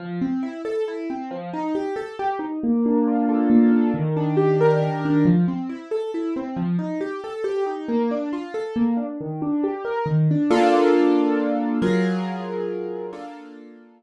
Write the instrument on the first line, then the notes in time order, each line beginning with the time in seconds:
acoustic grand piano
0.00 F3
0.21 C4
0.43 E4
0.65 A4
0.88 E4
1.10 C4
1.31 F3
1.53 D#4
1.75 G4
1.96 A4
2.19 G4
2.39 D#4
2.63 A#3
2.86 D4
3.07 F4
3.29 A4
3.50 A#3
3.72 D4
3.94 D#3
4.17 D4
4.37 G4
4.61 A#4
4.82 D#3
5.05 D4
5.25 F3
5.48 C4
5.69 E4
5.91 A4
6.14 E4
6.36 C4
6.56 F3
6.79 D#4
7.01 G4
7.24 A4
7.44 G4
7.66 D#4
7.89 A#3
8.11 D4
8.33 F4
8.54 A4
8.76 A#3
8.97 D4
9.21 D#3
9.42 D4
9.64 G4
9.85 A#4
10.06 D#3
10.31 D4
10.51 A#3 D4 F4 A4
11.82 F#3 F4 G#4 A#4
13.13 A#3 D4 F4 A4